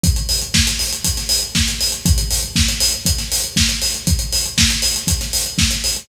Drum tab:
HH |xxox-xoxxxox-xox|xxox-xoxxxox-xox|xxox-xoxxxox-xox|
SD |----o----o--o---|----o----o--o---|----o----o--o---|
BD |o---o---o---o---|o---o---o---o---|o---o---o---o---|